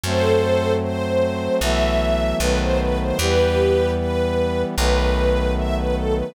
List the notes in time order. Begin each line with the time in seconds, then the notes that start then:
0.03 F#2 F#3 A3 C4 A4 C5
0.82 C5
1.60 B1 E3 F#3 A3 B3 E5
2.40 B1 D#3 F#3 A3 B3 B4
2.60 C5
2.79 B4
3.01 C5
3.19 E2 E3 G3 B3 G4 B4
3.98 B4
4.76 B1 D#3 F#3 A3 B3 B4
5.56 E5
5.76 B4
5.95 A4
6.15 B4